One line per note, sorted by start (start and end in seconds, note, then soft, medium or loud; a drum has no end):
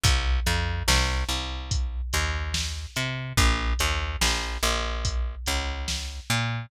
0.03 0.40 C2 loud
0.03 kick loud
0.03 closed hi-hat loud
0.46 0.83 F2 loud
0.46 closed hi-hat medium
0.88 1.24 C2 loud
0.88 snare loud
1.29 2.01 C2 medium
1.29 closed hi-hat medium
1.71 kick medium
1.71 closed hi-hat medium
2.13 2.86 D#2 loud
2.13 closed hi-hat medium
2.54 snare loud
2.96 3.33 C3 medium
2.96 closed hi-hat medium
3.37 3.74 A#1 loud
3.37 kick medium
3.37 closed hi-hat loud
3.79 4.17 D#2 loud
3.79 closed hi-hat medium
4.21 4.58 A#1 loud
4.21 snare loud
4.63 5.36 A#1 loud
4.63 closed hi-hat medium
5.05 kick medium
5.05 closed hi-hat medium
5.46 6.20 C#2 loud
5.46 closed hi-hat medium
5.88 snare medium
6.30 6.66 A#2 loud
6.30 closed hi-hat medium